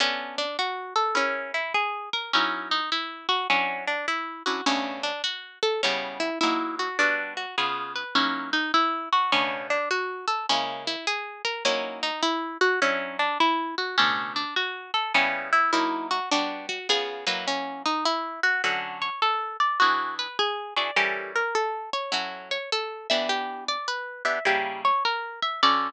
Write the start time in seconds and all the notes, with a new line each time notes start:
0.00 B3 C#4 D4 A4
0.38 D4
0.59 F#4
0.96 A4
1.15 C#4 E4 G#4 A#4
1.54 E4
1.74 G#4
2.13 A#4
2.33 F#3 C#4 D#4 E4 A#4
2.71 D#4
2.92 E4
3.29 F#4
3.50 F#3 C#4 D4 E4
3.87 D4
4.08 E4
4.46 F#3 C#4 D4 E4 F#4
4.66 B2 C#3 A3 C#4 D4
5.03 D4
5.24 F#4
5.63 A4
5.83 C#3 G3 B3 C#4 E4
6.20 E4
6.41 F#3 A#3 D#4 E4
6.79 F#4
6.99 G3 B3 D4 F#4
7.37 F#4
7.58 C#3 B3 F4 G#4
7.96 B4
8.15 F#3 A#3 C#4 D#4 E4
8.53 D#4
8.74 E4
9.12 F#4
9.32 B2 C#3 A3 C#4 D4
9.70 D4
9.91 F#4
10.28 A4
10.49 C#3 G#3 A#3 C#4 E4
10.87 E4
11.07 G#4
11.45 A#4
11.65 F#3 A#3 C#4 D#4 E4
12.03 D#4
12.23 E4
12.61 F#4
12.82 F#3 C#4 D4 E4
13.19 D4
13.40 E4
13.78 F#4
13.98 B2 C#3 A3 C#4 D4
14.36 D4
14.56 F#4
14.94 A4
15.14 C#3 G3 B3 C#4 E4
15.53 E4
15.73 F#3 A#3 D#4 E4
16.11 F#4
16.31 G3 B3 D4 F#4
16.69 F#4
16.89 C#3 B3 F4 G#4
17.27 F#3 A#3 D#4 E4 B4
17.48 C#4
17.86 D#4
18.05 E4
18.43 F#4
18.64 D3 F#3 C#4 F#4 A4
19.02 C#5
19.22 A4
19.60 D5
19.80 E3 D4 F#4 G#4
20.19 B4
20.39 G#4
20.76 E3 D4 F#4 G#4 D5
20.96 E3 G3 C#4 G4 A4 A#4
21.36 A#4
21.55 A4
21.93 C#5
22.12 F#3 C#4 E4 F#4 A4
22.51 C#5
22.72 A4
23.10 E3 B3 D4 G4 E5
23.29 G4
23.68 D5
23.88 B4
24.25 E3 B3 D4 G4 E5
24.45 C#3 G3 A#3 E4 G4
24.85 C#5
25.05 A#4
25.42 E5
25.63 D3 C#4 F#4 A4 D5